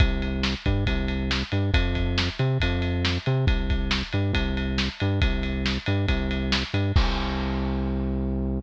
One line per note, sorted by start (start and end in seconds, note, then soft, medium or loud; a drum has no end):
0.00 0.54 C2 loud
0.00 kick medium
0.00 ride medium
0.22 ride medium
0.43 snare medium
0.66 0.85 G2 medium
0.66 kick medium
0.66 ride medium
0.87 1.43 C2 medium
0.87 kick medium
0.87 ride medium
1.08 ride medium
1.31 snare medium
1.52 1.71 G2 medium
1.52 ride medium
1.74 2.29 F2 medium
1.74 kick loud
1.74 ride loud
1.95 kick medium
1.95 ride medium
2.18 snare loud
2.39 2.58 C3 medium
2.39 ride medium
2.60 3.18 F2 medium
2.60 kick medium
2.60 ride medium
2.82 ride medium
3.05 snare loud
3.26 3.45 C3 medium
3.26 ride medium
3.47 4.03 C2 medium
3.47 kick loud
3.47 ride medium
3.70 kick medium
3.70 ride medium
3.91 snare loud
4.13 4.32 G2 medium
4.13 ride medium
4.33 4.89 C2 medium
4.33 kick medium
4.33 ride medium
4.57 ride medium
4.78 snare medium
5.00 5.20 G2 medium
5.00 ride medium
5.22 5.78 C2 medium
5.22 kick medium
5.22 ride medium
5.43 ride medium
5.66 snare medium
5.86 6.06 G2 medium
5.86 ride medium
6.08 6.63 C2 loud
6.08 kick medium
6.08 ride medium
6.31 ride medium
6.52 snare loud
6.74 6.92 G2 medium
6.74 ride medium
6.96 8.60 C2 loud
6.96 kick loud
6.96 crash loud